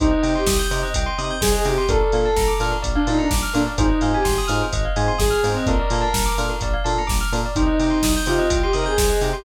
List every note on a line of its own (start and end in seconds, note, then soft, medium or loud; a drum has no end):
0.00 0.13 C2 medium
0.00 0.08 C4 medium
0.00 0.08 D#4 medium
0.00 0.34 D#4 medium
0.00 0.08 G4 medium
0.00 0.11 C5 loud
0.00 kick loud
0.00 closed hi-hat loud
0.11 0.22 D#5 medium
0.23 0.36 C3 medium
0.23 0.40 C4 medium
0.23 0.40 D#4 medium
0.23 0.40 G4 medium
0.23 0.33 G5 medium
0.23 open hi-hat medium
0.35 0.55 G4 medium
0.35 0.46 C6 medium
0.47 0.60 C2 medium
0.47 0.58 D#6 medium
0.47 kick medium
0.47 snare loud
0.59 0.69 G6 medium
0.71 0.84 C3 medium
0.71 0.87 C4 medium
0.71 0.87 D#4 medium
0.71 0.87 G4 medium
0.71 0.81 C5 medium
0.71 open hi-hat medium
0.83 0.93 D#5 loud
0.94 1.07 C2 medium
0.94 1.06 G5 loud
0.94 kick medium
0.94 closed hi-hat loud
1.06 1.17 C6 loud
1.18 1.31 C3 medium
1.18 1.35 C4 medium
1.18 1.35 D#4 medium
1.18 1.35 G4 medium
1.18 1.29 D#6 medium
1.18 open hi-hat medium
1.31 1.41 G6 medium
1.41 1.55 C2 medium
1.41 1.53 G#4 medium
1.41 1.52 C5 medium
1.41 kick medium
1.41 snare loud
1.52 1.65 G#4 medium
1.52 1.63 D#5 medium
1.65 1.78 C3 medium
1.65 1.74 C4 medium
1.65 1.74 D#4 medium
1.65 1.84 G4 medium
1.65 1.74 G4 medium
1.65 1.76 G5 medium
1.65 open hi-hat medium
1.78 1.88 C6 medium
1.89 2.02 A#1 medium
1.89 1.97 A#3 loud
1.89 1.97 D4 medium
1.89 1.97 F4 medium
1.89 1.97 A4 medium
1.89 2.51 A4 medium
1.89 2.01 A#4 loud
1.89 kick loud
1.89 closed hi-hat loud
2.00 2.11 D5 medium
2.12 2.26 A#2 medium
2.12 2.29 A#3 medium
2.12 2.29 D4 medium
2.12 2.29 F4 medium
2.12 2.29 A4 medium
2.12 2.24 F5 medium
2.12 open hi-hat medium
2.25 2.36 A5 medium
2.36 2.49 A#1 medium
2.36 2.47 A#5 loud
2.36 kick medium
2.36 snare loud
2.48 2.58 D6 medium
2.60 2.73 A#2 medium
2.60 2.76 A#3 medium
2.60 2.76 D4 medium
2.60 2.76 F4 medium
2.60 2.76 A4 medium
2.60 2.71 F6 medium
2.60 open hi-hat medium
2.71 2.82 A#4 medium
2.82 2.97 A#1 medium
2.82 2.93 D5 medium
2.82 kick medium
2.82 closed hi-hat loud
2.95 3.07 D4 medium
2.95 3.06 F5 medium
3.07 3.20 A#2 medium
3.07 3.24 A#3 medium
3.07 3.24 D4 medium
3.07 3.18 D#4 medium
3.07 3.24 F4 medium
3.07 3.24 A4 medium
3.07 3.18 A5 medium
3.07 open hi-hat medium
3.19 3.30 D4 medium
3.19 3.29 A#5 medium
3.30 3.44 A#1 medium
3.30 3.41 D6 medium
3.30 kick loud
3.30 snare loud
3.42 3.53 F6 medium
3.54 3.68 A#2 medium
3.54 3.63 A#3 medium
3.54 3.63 D4 medium
3.54 3.66 D4 medium
3.54 3.63 F4 medium
3.54 3.63 A4 medium
3.54 3.64 A#4 medium
3.54 open hi-hat medium
3.66 3.77 D5 medium
3.78 3.91 G#1 medium
3.78 3.86 C4 loud
3.78 3.86 D#4 medium
3.78 4.11 D#4 medium
3.78 3.86 F4 medium
3.78 3.86 G#4 medium
3.78 3.89 C5 loud
3.78 kick loud
3.78 closed hi-hat loud
3.89 4.00 D#5 medium
4.01 4.15 G#2 medium
4.01 4.18 C4 medium
4.01 4.18 D#4 medium
4.01 4.18 F4 medium
4.01 4.18 G#4 medium
4.01 4.12 F5 medium
4.01 open hi-hat medium
4.14 4.34 G4 medium
4.14 4.25 G#5 loud
4.25 4.38 G#1 medium
4.25 4.35 C6 loud
4.25 kick medium
4.25 snare loud
4.38 4.49 D#6 medium
4.48 4.62 G#2 medium
4.48 4.65 C4 medium
4.48 4.65 D#4 medium
4.48 4.65 F4 medium
4.48 4.65 G#4 medium
4.48 4.58 F6 medium
4.48 open hi-hat medium
4.62 4.72 C5 medium
4.72 4.85 G#1 medium
4.72 4.84 D#5 medium
4.72 kick medium
4.72 closed hi-hat loud
4.85 4.95 F5 medium
4.96 5.09 G#2 medium
4.96 5.13 C4 medium
4.96 5.13 D#4 medium
4.96 5.13 F4 medium
4.96 5.13 G#4 medium
4.96 5.07 G#5 medium
4.96 open hi-hat medium
5.08 5.19 C6 medium
5.18 5.32 G#1 medium
5.18 5.31 G#4 medium
5.18 5.29 D#6 medium
5.18 kick medium
5.18 snare loud
5.30 5.43 G#4 medium
5.30 5.41 F6 medium
5.43 5.56 G#2 medium
5.43 5.52 C4 medium
5.43 5.66 C4 medium
5.43 5.52 D#4 medium
5.43 5.52 F4 medium
5.43 5.52 G#4 medium
5.43 5.55 C5 medium
5.43 open hi-hat medium
5.57 5.67 D#5 medium
5.66 5.80 A#1 medium
5.66 5.75 A#3 medium
5.66 5.75 D4 medium
5.66 5.75 F4 loud
5.66 5.75 A4 medium
5.66 6.34 A#4 medium
5.66 5.78 A#4 loud
5.66 kick loud
5.66 closed hi-hat medium
5.79 5.90 D5 medium
5.90 6.04 A#2 medium
5.90 6.07 A#3 medium
5.90 6.07 D4 medium
5.90 6.07 F4 medium
5.90 6.07 A4 medium
5.90 6.03 F5 medium
5.90 open hi-hat medium
6.01 6.12 A5 medium
6.13 6.27 A#1 medium
6.13 6.24 A#5 medium
6.13 kick medium
6.13 snare loud
6.26 6.36 D6 medium
6.38 6.51 A#2 medium
6.38 6.54 A#3 medium
6.38 6.54 D4 medium
6.38 6.54 F4 medium
6.38 6.54 A4 medium
6.38 6.49 F6 medium
6.38 open hi-hat medium
6.49 6.60 A#4 medium
6.61 6.75 A#1 medium
6.61 6.73 D5 medium
6.61 kick medium
6.61 closed hi-hat loud
6.74 6.84 F5 medium
6.84 6.98 A#2 medium
6.84 7.02 A#3 medium
6.84 7.02 D4 medium
6.84 7.02 F4 medium
6.84 7.02 A4 medium
6.84 6.95 A5 medium
6.84 open hi-hat medium
6.98 7.09 A#5 medium
7.07 7.22 A#1 medium
7.07 7.18 D6 medium
7.07 kick medium
7.07 snare loud
7.21 7.31 F6 medium
7.32 7.45 A#2 medium
7.32 7.41 A#3 medium
7.32 7.41 D4 medium
7.32 7.41 F4 medium
7.32 7.41 A4 medium
7.32 7.43 A#4 medium
7.32 open hi-hat medium
7.46 7.56 D5 medium
7.56 7.69 C2 medium
7.56 7.64 C4 medium
7.56 8.13 D#4 medium
7.56 7.64 D#4 medium
7.56 7.64 G4 medium
7.56 7.67 C5 loud
7.56 kick loud
7.56 closed hi-hat loud
7.67 7.77 D#5 medium
7.79 7.92 C3 medium
7.79 7.96 C4 medium
7.79 7.96 D#4 medium
7.79 7.96 G4 medium
7.79 7.91 G5 medium
7.79 open hi-hat medium
7.90 8.01 C6 medium
8.03 8.16 C2 medium
8.03 8.14 D#6 medium
8.03 kick medium
8.03 snare loud
8.17 8.27 G6 medium
8.26 8.40 C3 medium
8.26 8.43 C4 medium
8.26 8.43 D#4 medium
8.26 8.59 F4 medium
8.26 8.43 G4 medium
8.26 8.37 C5 medium
8.26 open hi-hat medium
8.39 8.49 D#5 loud
8.50 8.63 C2 medium
8.50 8.61 G5 loud
8.50 kick medium
8.50 closed hi-hat loud
8.62 8.73 G4 medium
8.62 8.74 C6 loud
8.73 8.87 C3 medium
8.73 8.91 C4 medium
8.73 8.91 D#4 medium
8.73 8.91 G4 medium
8.73 8.85 A#4 medium
8.73 8.84 D#6 medium
8.73 open hi-hat medium
8.86 8.97 G#4 medium
8.86 8.96 G6 medium
8.98 9.11 C2 medium
8.98 9.21 G#4 medium
8.98 9.09 C5 medium
8.98 kick medium
8.98 snare loud
9.10 9.20 D#5 medium
9.21 9.34 C3 medium
9.21 9.30 C4 medium
9.21 9.30 D#4 medium
9.21 9.30 G4 medium
9.21 9.33 G5 medium
9.21 open hi-hat medium
9.33 9.44 G4 medium
9.33 9.44 C6 medium